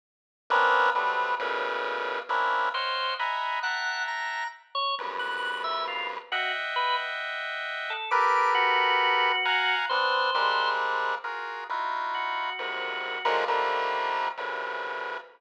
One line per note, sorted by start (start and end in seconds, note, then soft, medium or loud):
0.50 0.90 A#3 loud
0.50 0.90 B3 loud
0.50 0.90 C4 loud
0.50 0.90 C#4 loud
0.50 0.90 D4 loud
0.95 1.35 F#3 medium
0.95 1.35 G3 medium
0.95 1.35 A3 medium
0.95 1.35 B3 medium
0.95 1.35 C4 medium
0.95 1.35 D4 medium
1.39 2.20 A2 loud
1.39 2.20 A#2 loud
1.39 2.20 B2 loud
1.39 2.20 C#3 loud
2.29 2.69 A#3 medium
2.29 2.69 C4 medium
2.29 2.69 C#4 medium
2.29 2.69 D4 medium
2.29 2.69 E4 medium
2.74 3.15 C5 medium
2.74 3.14 C#5 medium
2.74 3.14 D#5 medium
2.74 3.14 F5 medium
2.74 3.14 F#5 medium
2.74 3.14 G5 medium
3.19 3.60 D#5 medium
3.19 3.60 E5 medium
3.19 3.60 F#5 medium
3.19 3.60 G#5 medium
3.19 3.60 A#5 medium
3.19 3.60 B5 medium
3.63 4.44 E5 medium
3.63 4.03 F#5 medium
3.63 4.44 F#5 medium
3.63 4.44 G5 medium
3.63 4.44 A5 medium
3.63 4.44 A#5 medium
4.08 4.48 A#5 medium
4.75 4.95 C#5 loud
4.98 6.19 E2 medium
4.98 6.19 F2 medium
4.98 6.19 F#2 medium
4.98 6.19 G2 medium
5.19 5.60 F#6 medium
5.64 5.84 E5 medium
5.88 6.08 F4 medium
6.32 6.52 F#4 medium
6.32 7.93 D#5 medium
6.32 7.93 E5 medium
6.32 7.93 F#5 medium
6.32 7.93 G5 medium
6.76 6.96 B4 medium
7.90 8.10 A4 medium
8.11 9.32 G4 medium
8.11 9.32 A4 medium
8.11 9.32 A#4 medium
8.11 9.32 B4 medium
8.11 8.51 D6 medium
8.54 9.75 F#4 loud
9.45 9.86 F5 medium
9.45 9.86 F#5 medium
9.45 9.86 G#5 medium
9.45 9.86 A#5 medium
9.89 10.31 B3 medium
9.89 10.31 C4 medium
9.89 10.31 D4 medium
9.89 10.70 C5 medium
10.34 11.15 G3 medium
10.34 11.15 G#3 medium
10.34 11.15 A#3 medium
10.34 11.15 C4 medium
10.34 11.15 D4 medium
11.24 11.64 F4 medium
11.24 11.64 F#4 medium
11.24 11.64 G#4 medium
11.24 11.64 A#4 medium
11.69 12.50 D#4 medium
11.69 12.50 E4 medium
11.69 12.50 F4 medium
11.69 12.50 F#4 medium
12.14 13.35 F#4 medium
12.58 13.19 F2 medium
12.58 13.19 F#2 medium
12.58 13.19 G#2 medium
12.58 13.19 A#2 medium
12.58 13.19 C3 medium
13.25 13.45 D3 loud
13.25 13.45 D#3 loud
13.25 13.45 F3 loud
13.25 13.45 F#3 loud
13.25 13.45 G#3 loud
13.25 13.45 A#3 loud
13.48 14.28 D3 medium
13.48 14.28 D#3 medium
13.48 14.28 F3 medium
13.48 14.28 G3 medium
13.48 14.28 A3 medium
13.48 14.28 A#3 medium
14.37 15.18 A#2 medium
14.37 15.18 C3 medium
14.37 15.18 C#3 medium
14.37 15.18 D3 medium
14.37 15.18 E3 medium
14.37 15.18 F#3 medium